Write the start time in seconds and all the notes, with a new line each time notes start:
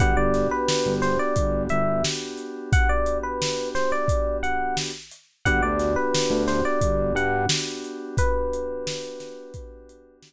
0.00 G1 B3 D4 F#4 G4 F#5, kick, closed hi-hat
0.17 G1 D5
0.34 snare, closed hi-hat
0.51 B4
0.68 snare
0.86 G1
1.02 C5, snare, closed hi-hat
1.19 D5
1.36 G1, kick, closed hi-hat
1.69 G1 E5, closed hi-hat
2.04 snare
2.37 closed hi-hat
2.72 F#5, kick, closed hi-hat
2.89 D5
3.06 closed hi-hat
3.23 B4
3.42 snare
3.75 C5, snare, closed hi-hat
3.92 D5
4.08 kick, closed hi-hat
4.43 F#5, closed hi-hat
4.77 snare
5.12 closed hi-hat
5.45 G1 B3 D4 F#4 G4 F#5, kick, closed hi-hat
5.62 D2 D5
5.80 snare, closed hi-hat
5.96 B4
6.14 snare
6.30 D2
6.48 C5, snare, closed hi-hat
6.65 D5
6.81 G1, kick, closed hi-hat
7.15 G2 F#5, closed hi-hat
7.49 snare
7.84 closed hi-hat
8.17 B4, kick, closed hi-hat
8.53 closed hi-hat
8.87 snare
9.20 snare, closed hi-hat
9.54 kick, closed hi-hat
9.89 closed hi-hat
10.23 snare